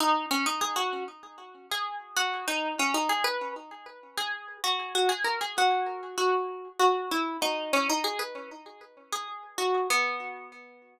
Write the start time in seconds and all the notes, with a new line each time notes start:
0.00 D#4
0.31 C#4
0.46 D#4
0.61 G#4
0.76 F#4
1.71 G#4
2.16 F#4
2.48 D#4
2.79 C#4
2.94 D#4
3.09 G#4
3.24 B4
4.18 G#4
4.64 F#4
4.95 F#4
5.09 G#4
5.24 A#4
5.41 G#4
5.58 F#4
6.18 F#4
6.79 F#4
7.11 E4
7.42 D#4
7.73 C#4
7.90 D#4
8.04 G#4
8.19 B4
9.13 G#4
9.58 F#4
9.90 B3